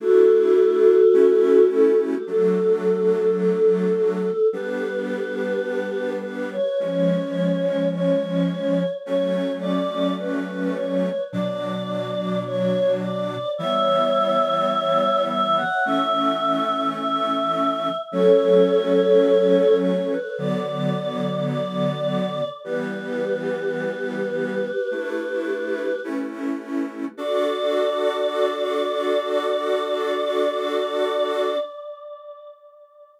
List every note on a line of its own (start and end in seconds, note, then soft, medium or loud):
0.00 1.02 A3 medium
0.00 1.02 D4 medium
0.00 1.02 E4 medium
0.00 1.67 F#4 medium
0.00 1.67 A4 loud
1.13 2.15 A3 medium
1.13 2.15 C#4 medium
1.13 2.15 E4 medium
1.71 1.98 A4 medium
1.98 2.25 G4 medium
2.26 4.30 F#3 medium
2.26 4.30 A3 medium
2.26 4.30 D4 medium
2.26 3.34 A4 medium
3.40 4.46 A4 medium
4.53 6.56 G3 medium
4.53 6.56 B3 medium
4.53 6.56 D4 medium
4.53 6.10 G4 medium
4.53 6.10 B4 medium
6.22 6.49 B4 medium
6.52 6.79 C#5 medium
6.79 8.83 F3 medium
6.79 8.83 G#3 medium
6.79 8.83 C#4 medium
6.79 7.88 C#5 medium
7.93 8.89 C#5 medium
9.06 11.09 F#3 medium
9.06 11.09 A3 medium
9.06 11.09 C#4 medium
9.06 9.52 C#5 loud
9.61 10.13 D5 medium
10.19 10.73 B4 medium
10.75 11.21 C#5 medium
11.32 13.36 B2 medium
11.32 13.36 F#3 medium
11.32 13.36 D4 medium
11.32 12.40 D5 medium
12.47 12.92 C#5 loud
13.02 13.50 D5 medium
13.58 15.62 E3 medium
13.58 15.62 G3 medium
13.58 15.62 B3 medium
13.58 15.22 C#5 medium
13.58 15.22 E5 medium
15.29 15.56 E5 loud
15.57 15.84 F#5 medium
15.85 17.89 E3 medium
15.85 17.89 A3 loud
15.85 17.89 C#4 medium
15.85 16.86 E5 medium
16.97 17.95 E5 medium
18.12 20.15 F#3 medium
18.12 20.15 A3 medium
18.12 20.15 C#4 medium
18.12 19.77 A4 medium
18.12 19.77 C#5 loud
19.80 20.07 C#5 medium
20.10 20.37 B4 medium
20.37 22.41 D3 medium
20.37 22.41 F#3 medium
20.37 22.41 B3 medium
20.37 21.43 D5 medium
21.50 22.47 D5 medium
22.64 24.68 E3 medium
22.64 24.68 G3 medium
22.64 24.68 B3 medium
22.64 26.00 G4 medium
22.64 26.00 B4 medium
24.91 25.92 A3 medium
24.91 25.92 D4 medium
24.91 25.92 E4 medium
26.04 27.05 A3 medium
26.04 27.05 C#4 medium
26.04 27.05 E4 medium
27.17 31.57 D4 loud
27.17 31.57 F#4 loud
27.17 31.57 A4 loud
27.17 31.57 D5 loud